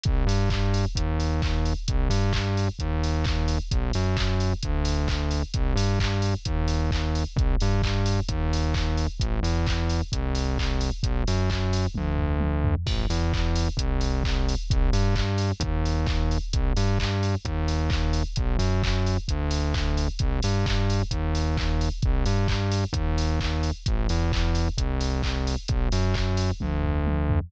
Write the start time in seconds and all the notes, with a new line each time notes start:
0.04 C2, kick, closed hi-hat
0.27 G2, open hi-hat
0.50 kick, clap
0.74 open hi-hat
0.95 D#2, kick, closed hi-hat
1.20 open hi-hat
1.42 kick, clap
1.65 open hi-hat
1.88 C2, kick, closed hi-hat
2.10 G2, open hi-hat
2.33 kick, clap
2.57 open hi-hat
2.79 D#2, kick, closed hi-hat
3.04 open hi-hat
3.24 kick, clap
3.48 open hi-hat
3.71 B1, kick, closed hi-hat
3.93 F#2, open hi-hat
4.17 kick, clap
4.40 open hi-hat
4.63 D2, kick, closed hi-hat
4.85 open hi-hat
5.08 kick, clap
5.31 open hi-hat
5.54 C2, kick, closed hi-hat
5.76 G2, open hi-hat
6.00 kick, clap
6.22 open hi-hat
6.45 D#2, kick, closed hi-hat
6.68 open hi-hat
6.91 kick, clap
7.15 open hi-hat
7.36 C2, kick, closed hi-hat
7.60 G2, open hi-hat
7.82 kick, clap
8.06 open hi-hat
8.29 D#2, kick, closed hi-hat
8.53 open hi-hat
8.74 kick, clap
8.97 open hi-hat
9.20 A1, kick, closed hi-hat
9.43 E2, open hi-hat
9.66 kick, clap
9.90 open hi-hat
10.12 C2, kick, closed hi-hat
10.35 open hi-hat
10.58 kick, clap
10.81 open hi-hat
11.03 B1, kick, closed hi-hat
11.27 F#2, open hi-hat
11.50 kick, clap
11.73 open hi-hat
11.95 D2, kick, high tom
12.18 floor tom
12.40 high tom
12.65 floor tom
12.86 A1, kick, crash
13.10 E2, open hi-hat
13.33 kick, clap
13.56 open hi-hat
13.77 C2, kick, closed hi-hat
14.01 open hi-hat
14.24 kick, clap
14.49 open hi-hat
14.70 C2, kick, closed hi-hat
14.93 G2, open hi-hat
15.16 kick, clap
15.38 open hi-hat
15.60 D#2, kick, closed hi-hat
15.85 open hi-hat
16.06 kick, clap
16.31 open hi-hat
16.53 C2, kick, closed hi-hat
16.77 G2, open hi-hat
16.99 kick, clap
17.23 open hi-hat
17.45 D#2, kick, closed hi-hat
17.68 open hi-hat
17.90 kick, clap
18.13 open hi-hat
18.36 B1, kick, closed hi-hat
18.59 F#2, open hi-hat
18.83 kick, clap
19.06 open hi-hat
19.28 D2, kick, closed hi-hat
19.51 open hi-hat
19.74 kick, clap
19.97 open hi-hat
20.19 C2, kick, closed hi-hat
20.42 G2, open hi-hat
20.66 kick, clap
20.90 open hi-hat
21.11 D#2, kick, closed hi-hat
21.35 open hi-hat
21.57 kick, clap
21.81 open hi-hat
22.02 C2, kick, closed hi-hat
22.26 G2, open hi-hat
22.48 kick, clap
22.72 open hi-hat
22.93 D#2, kick, closed hi-hat
23.18 open hi-hat
23.40 kick, clap
23.63 open hi-hat
23.86 A1, kick, closed hi-hat
24.09 E2, open hi-hat
24.32 kick, clap
24.55 open hi-hat
24.78 C2, kick, closed hi-hat
25.01 open hi-hat
25.23 kick, clap
25.47 open hi-hat
25.68 B1, kick, closed hi-hat
25.92 F#2, open hi-hat
26.14 kick, clap
26.37 open hi-hat
26.60 D2, kick, high tom
26.83 floor tom
27.07 high tom
27.29 floor tom